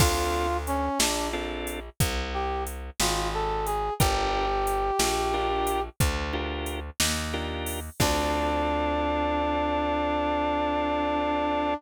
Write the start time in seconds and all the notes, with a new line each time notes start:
0.00 D2 C4 D4 F4 A4, kick, crash
0.67 C#4, closed hi-hat
0.99 A#1 D4, snare
1.33 C4 D4 F4 A4
1.67 closed hi-hat
2.00 C2, kick, closed hi-hat
2.34 G4
2.67 closed hi-hat
3.00 G#1 F4, snare
3.34 A4
3.66 G#4, closed hi-hat
4.00 G1 D4 F4 G4 A#4, kick, closed hi-hat
4.67 closed hi-hat
4.99 A#1, snare
5.33 D4 F4 G4 A#4
5.67 closed hi-hat
6.00 D2, kick, closed hi-hat
6.33 D4 F4 G4 A#4
6.66 closed hi-hat
7.00 D#2, snare
7.33 D4 F4 G4 A#4
7.66 open hi-hat
8.00 D2 C4 D4 F4 A4, kick, crash